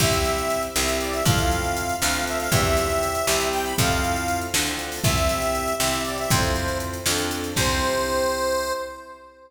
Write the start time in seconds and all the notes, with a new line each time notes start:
0.00 C2 C4 E4 G4 E5, kick, crash
0.13 closed hi-hat
0.25 closed hi-hat
0.38 closed hi-hat
0.50 closed hi-hat
0.63 closed hi-hat
0.76 C2 C4 E4 G4 E5, snare
0.88 closed hi-hat
1.00 D5, closed hi-hat
1.13 E5, closed hi-hat
1.25 F2 C4 E4 F4 A4 F5, kick, closed hi-hat
1.38 closed hi-hat
1.51 closed hi-hat
1.64 closed hi-hat
1.77 closed hi-hat
1.89 closed hi-hat
2.01 D2 C4 D4 F4 A4 F5, snare
2.14 closed hi-hat
2.27 E5, closed hi-hat
2.40 F5, closed hi-hat
2.52 E2 C4 E4 G4 E5, kick, closed hi-hat
2.65 closed hi-hat
2.77 closed hi-hat
2.90 closed hi-hat
3.03 closed hi-hat
3.15 closed hi-hat
3.27 C2 C4 E4 G4 E5, snare
3.40 closed hi-hat
3.53 G5, closed hi-hat
3.64 B5, closed hi-hat
3.78 F2 C4 E4 F4 A4 F5, kick, closed hi-hat
3.91 closed hi-hat
4.04 closed hi-hat
4.16 closed hi-hat
4.28 closed hi-hat
4.41 closed hi-hat
4.54 D2 C4 D4 F4 A4, snare
4.67 closed hi-hat
4.79 closed hi-hat
4.92 open hi-hat
5.04 C2 C4 E4 G4 E5, kick, closed hi-hat
5.17 closed hi-hat
5.29 closed hi-hat
5.42 closed hi-hat
5.55 closed hi-hat
5.68 closed hi-hat
5.79 C2 C4 E4 G4 E5, snare
5.93 closed hi-hat
6.05 D5, closed hi-hat
6.18 E5, closed hi-hat
6.30 F2 C4 E4 F4 A4 C5, kick, closed hi-hat
6.43 closed hi-hat
6.55 closed hi-hat
6.68 closed hi-hat
6.80 closed hi-hat
6.93 closed hi-hat
7.06 F2 C4 D4 F4 A4, snare
7.18 closed hi-hat
7.31 closed hi-hat
7.44 closed hi-hat
7.56 C2 C4 E4 G4 C5, kick, crash